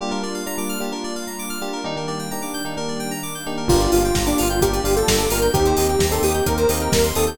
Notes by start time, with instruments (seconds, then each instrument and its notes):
0.01 electric piano 1 G3 A#3 D4 F4, pad 5 (bowed) G3 A#3 D4 F4, electric piano 2 G4
0.11 electric piano 1 G3 A#3 D4 F4, electric piano 2 A#4
0.22 electric piano 1 G3 A#3 D4 F4, electric piano 2 D5
0.34 electric piano 2 F5
0.46 electric piano 1 G3 A#3 D4 F4, electric piano 2 A#5
0.58 electric piano 1 G3 A#3 D4 F4, electric piano 2 D6
0.69 electric piano 2 F6
0.80 electric piano 1 G3 A#3 D4 F4, electric piano 2 G4
0.92 electric piano 1 G3 A#3 D4 F4, electric piano 2 A#4
1.04 electric piano 2 D5
1.16 electric piano 2 F5
1.27 electric piano 2 A#5
1.39 electric piano 2 D6
1.50 electric piano 2 F6
1.61 electric piano 1 G3 A#3 D4 F4, electric piano 2 G4
1.73 electric piano 2 A#4
1.84 electric piano 1 D#3 A#3 D4 G4, pad 5 (bowed) D#3 G3 A#3 D4, electric piano 2 D#4
1.96 electric piano 1 D#3 A#3 D4 G4, electric piano 2 A#4
2.07 electric piano 1 D#3 A#3 D4 G4, electric piano 2 D5
2.19 electric piano 2 G5
2.31 electric piano 1 D#3 A#3 D4 G4, electric piano 2 A#5
2.42 electric piano 1 D#3 A#3 D4 G4, electric piano 2 D6
2.54 electric piano 2 G6
2.65 electric piano 1 D#3 A#3 D4 G4, electric piano 2 D#4
2.77 electric piano 1 D#3 A#3 D4 G4, electric piano 2 A#4
2.88 electric piano 2 D5
3.00 electric piano 2 G5
3.11 electric piano 2 A#5
3.23 electric piano 2 D6
3.35 electric piano 2 G6
3.46 electric piano 1 D#3 A#3 D4 G4, electric piano 2 D#4
3.57 electric piano 2 A#4
3.68 synth bass 1 G1, pad 5 (bowed) A#3 D4 F4 G4, electric piano 1 A#3 D4 F4 G4, lead 2 (sawtooth) F4, electric piano 2 A#4, kick, crash
3.80 electric piano 2 D5, closed hi-hat
3.92 synth bass 1 G1, lead 2 (sawtooth) F4, electric piano 2 F5, open hi-hat
4.05 electric piano 2 G5, closed hi-hat
4.15 synth bass 1 G1, electric piano 2 A#5, kick, snare
4.26 electric piano 1 A#3 D4 F4 G4, lead 2 (sawtooth) D4, electric piano 2 D6, closed hi-hat
4.38 synth bass 1 G1, lead 2 (sawtooth) F4, electric piano 2 F6, open hi-hat
4.49 electric piano 1 A#3 D4 F4 G4, electric piano 2 G6, closed hi-hat
4.61 synth bass 1 G1, electric piano 1 A#3 D4 F4 G4, lead 2 (sawtooth) G4, electric piano 2 A#4, kick, closed hi-hat
4.73 electric piano 2 D5, closed hi-hat
4.84 synth bass 1 G1, electric piano 1 A#3 D4 F4 G4, electric piano 2 F5, open hi-hat
4.95 electric piano 1 A#3 D4 F4 G4, lead 2 (sawtooth) A4, electric piano 2 G5, closed hi-hat
5.07 synth bass 1 G1, electric piano 2 A#5, kick, snare
5.19 electric piano 2 D6, closed hi-hat
5.30 synth bass 1 G1, electric piano 1 A#3 D4 F4 G4, lead 2 (sawtooth) A#4, electric piano 2 F6, open hi-hat
5.42 electric piano 2 G6, closed hi-hat
5.53 synth bass 1 D#2, pad 5 (bowed) A#3 C4 D#4 G4, electric piano 1 A#3 C4 D#4 G4, lead 2 (sawtooth) G4, electric piano 2 A#4, kick, closed hi-hat
5.65 electric piano 2 C5, closed hi-hat
5.77 synth bass 1 D#2, lead 2 (sawtooth) G4, electric piano 2 D#5, open hi-hat
5.89 electric piano 2 G5, closed hi-hat
5.99 synth bass 1 D#2, electric piano 2 A#5, kick, snare
6.11 electric piano 1 A#3 C4 D#4 G4, lead 2 (sawtooth) A4, electric piano 2 C6, closed hi-hat
6.22 synth bass 1 D#2, lead 2 (sawtooth) G4, electric piano 2 D#6, open hi-hat
6.34 electric piano 1 A#3 C4 D#4 G4, electric piano 2 G6, closed hi-hat
6.46 synth bass 1 D#2, electric piano 1 A#3 C4 D#4 G4, electric piano 2 A#4, lead 2 (sawtooth) A#4, kick, closed hi-hat
6.57 electric piano 2 C5, closed hi-hat
6.69 synth bass 1 D#2, electric piano 1 A#3 C4 D#4 G4, electric piano 2 D#5, open hi-hat
6.80 electric piano 1 A#3 C4 D#4 G4, lead 2 (sawtooth) A#4, electric piano 2 G5, closed hi-hat
6.92 synth bass 1 D#2, electric piano 2 A#5, kick, snare
7.04 electric piano 2 C6, closed hi-hat
7.15 synth bass 1 D#2, electric piano 1 A#3 C4 D#4 G4, lead 2 (sawtooth) A4, electric piano 2 D#6, open hi-hat
7.27 electric piano 2 G6, closed hi-hat